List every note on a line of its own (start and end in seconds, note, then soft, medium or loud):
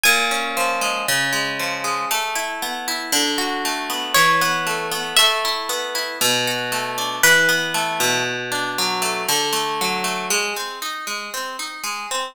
0.04 1.03 A#2 loud
0.04 1.97 G#5 medium
0.31 1.04 C#4 medium
0.57 1.06 F3 medium
0.81 1.06 G#3 medium
1.08 2.06 C#3 loud
1.33 1.84 G#3 medium
1.60 2.08 F3 medium
1.84 2.09 G#3 medium
2.11 3.08 A3 loud
2.35 2.87 E4 medium
2.62 3.11 B3 medium
2.88 3.12 E4 medium
3.12 4.10 D3 loud
3.38 4.11 F#4 medium
3.65 4.14 A3 medium
3.90 4.14 B3 medium
4.14 5.13 E3 medium
4.14 5.12 C#5 medium
4.41 4.91 B3 loud
4.67 5.15 A3 medium
4.92 5.16 B3 medium
5.17 6.16 A3 loud
5.17 6.14 E5 medium
5.45 5.94 E4 medium
5.69 6.18 B3 medium
5.95 6.19 E4 medium
6.21 7.18 B2 loud
6.47 7.20 F#4 medium
6.72 7.21 A3 medium
6.98 7.22 D4 medium
7.23 8.21 E3 loud
7.23 8.26 B4 medium
7.49 8.22 B3 medium
7.74 8.23 A3 medium
8.00 9.23 B2 loud
8.52 9.25 D4 medium
8.78 9.27 F#3 medium
9.02 9.26 A3 medium
9.29 10.26 D3 loud
9.53 10.04 A3 medium
9.81 10.30 F#3 medium
10.04 10.28 A3 medium
10.30 10.53 G#3 loud
10.57 10.80 C4 medium
10.82 11.05 D#4 medium
11.07 11.30 G#3 medium
11.34 11.57 C4 medium
11.59 11.82 D#4 medium
11.84 12.07 G#3 medium
12.11 12.34 C4 medium